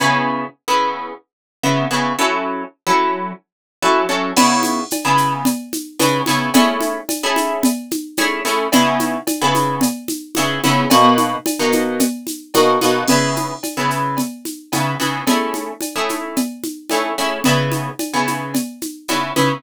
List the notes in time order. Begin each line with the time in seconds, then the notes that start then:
0.00 C#3 B3 E4 G#4
0.68 C#3 B3 E4 G#4
1.63 C#3 B3 E4 G#4
1.91 C#3 B3 E4 G#4
2.19 F#3 C#4 E4 A4
2.87 F#3 C#4 E4 A4
3.82 F#3 C#4 E4 A4
4.09 F#3 C#4 E4 A4
4.36 C#3 B3 E4 G#4, crash, cowbell, low conga, shaker
4.63 high conga, shaker
4.91 cowbell, high conga, shaker
5.05 C#3 B3 E4 G#4
5.17 shaker
5.45 cowbell, low conga, shaker
5.73 high conga, shaker
5.99 C#3 B3 E4 G#4, cowbell, high conga, shaker
6.26 C#3 B3 E4 G#4, high conga, shaker
6.54 A3 C#4 E4 G#4, cowbell, low conga, shaker
6.80 high conga, shaker
7.09 cowbell, high conga, shaker
7.23 A3 C#4 E4 G#4
7.36 high conga, shaker
7.63 cowbell, low conga, shaker
7.91 high conga, shaker
8.17 A3 C#4 E4 G#4, cowbell, high conga, shaker
8.45 A3 C#4 E4 G#4, shaker
8.72 C#3 B3 E4 G#4, cowbell, low conga, shaker
9.00 high conga, shaker
9.27 cowbell, high conga, shaker
9.41 C#3 B3 E4 G#4
9.55 high conga, shaker
9.81 cowbell, low conga, shaker
10.08 high conga, shaker
10.35 C#3 B3 E4 G#4, cowbell, high conga, shaker
10.64 C#3 B3 E4 G#4, high conga, shaker
10.90 B2 A#3 D#4 F#4, cowbell, low conga, shaker
11.18 high conga, shaker
11.46 cowbell, high conga, shaker
11.59 B2 A#3 D#4 F#4
11.72 high conga, shaker
12.00 cowbell, low conga, shaker
12.27 high conga, shaker
12.54 B2 A#3 D#4 F#4, cowbell, high conga, shaker
12.81 B2 A#3 D#4 F#4, high conga, shaker
13.08 C#3 B3 E4 G#4, crash, cowbell, low conga, shaker
13.36 high conga, shaker
13.63 cowbell, high conga, shaker
13.77 C#3 B3 E4 G#4
13.90 shaker
14.17 cowbell, low conga, shaker
14.45 high conga, shaker
14.72 C#3 B3 E4 G#4, cowbell, high conga, shaker
15.00 C#3 B3 E4 G#4, high conga, shaker
15.27 A3 C#4 E4 G#4, cowbell, low conga, shaker
15.54 high conga, shaker
15.81 cowbell, high conga, shaker
15.96 A3 C#4 E4 G#4
16.09 high conga, shaker
16.36 cowbell, low conga, shaker
16.64 high conga, shaker
16.89 A3 C#4 E4 G#4, cowbell, high conga, shaker
17.18 A3 C#4 E4 G#4, shaker
17.44 C#3 B3 E4 G#4, cowbell, low conga, shaker
17.72 high conga, shaker
17.99 cowbell, high conga, shaker
18.14 C#3 B3 E4 G#4
18.27 high conga, shaker
18.54 cowbell, low conga, shaker
18.82 high conga, shaker
19.08 C#3 B3 E4 G#4, cowbell, high conga, shaker
19.36 C#3 B3 E4 G#4, high conga, shaker